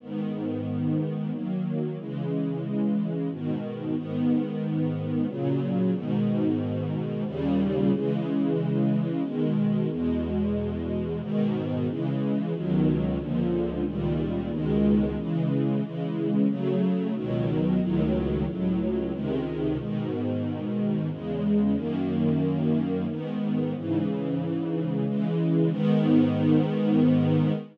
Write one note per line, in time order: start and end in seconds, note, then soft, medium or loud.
0.00 1.31 G#2 medium
0.00 1.31 D#3 medium
0.00 1.31 B3 medium
1.32 1.97 D#3 medium
1.32 1.97 F#3 medium
1.32 1.97 A#3 medium
1.98 3.29 C#3 medium
1.98 3.29 E3 medium
1.98 3.29 G#3 medium
3.30 3.95 G#2 medium
3.30 3.96 B2 medium
3.30 3.95 D#3 medium
3.96 5.26 G#2 medium
3.96 5.26 D#3 medium
3.96 5.26 B3 medium
5.27 5.93 A#2 medium
5.27 5.93 C#3 medium
5.27 5.93 F#3 medium
5.93 7.24 G#2 medium
5.93 7.24 B2 medium
5.93 7.24 D#3 medium
7.26 7.91 D#2 medium
7.26 7.91 A#2 medium
7.26 7.91 C#3 medium
7.26 7.91 G3 medium
7.92 9.22 C#3 medium
7.92 9.22 E3 medium
7.92 9.22 G#3 medium
9.23 9.88 B2 medium
9.23 9.88 D#3 medium
9.23 9.88 G#3 medium
9.89 11.20 E2 medium
9.89 11.20 B2 medium
9.89 11.20 G#3 medium
11.21 11.86 G#2 medium
11.21 11.86 B2 medium
11.21 11.86 D#3 medium
11.88 12.53 C#3 medium
11.88 12.53 E3 medium
11.88 12.53 G#3 medium
12.53 13.18 C#2 medium
12.53 13.18 B2 medium
12.53 13.18 D#3 medium
12.53 13.18 F#3 medium
13.18 13.84 C#2 medium
13.18 13.84 A#2 medium
13.18 13.84 D3 medium
13.18 13.84 F3 medium
13.86 14.50 C#2 medium
13.86 14.51 A#2 medium
13.86 14.50 D#3 medium
13.86 14.51 G3 medium
14.50 15.16 C#2 medium
14.50 15.16 B2 medium
14.50 15.16 D#3 medium
14.50 15.16 G#3 medium
15.17 15.81 C#3 medium
15.17 15.81 E3 medium
15.17 15.81 G#3 medium
15.82 16.47 C#3 medium
15.82 16.47 E3 medium
15.82 16.47 G#3 medium
16.47 17.13 C#3 medium
16.47 17.13 F#3 medium
16.47 17.13 A3 medium
17.14 17.79 C#2 medium
17.14 17.79 B2 medium
17.14 17.79 D#3 medium
17.14 17.79 F#3 medium
17.80 18.45 C#2 medium
17.80 18.45 A2 medium
17.80 18.45 D#3 medium
17.80 18.45 F#3 medium
18.46 19.12 C#2 medium
18.46 19.12 A2 medium
18.46 19.12 F#3 medium
19.12 19.78 C#2 medium
19.12 19.78 C3 medium
19.12 19.78 D#3 medium
19.12 19.78 G#3 medium
19.78 21.09 G#2 medium
19.78 21.09 B2 medium
19.78 21.09 D#3 medium
21.10 21.75 E2 medium
21.10 21.75 C#3 medium
21.10 21.75 G#3 medium
21.75 23.06 F#2 medium
21.75 23.06 D#3 medium
21.75 23.06 A#3 medium
23.08 23.73 G#2 medium
23.08 23.73 D#3 medium
23.08 23.73 B3 medium
23.74 25.05 G#2 medium
23.74 25.05 C#3 medium
23.74 25.05 E3 medium
25.05 25.71 C#3 medium
25.05 25.71 E3 medium
25.05 25.71 G#3 medium
25.71 27.52 G#2 loud
25.71 27.52 D#3 loud
25.71 27.52 B3 medium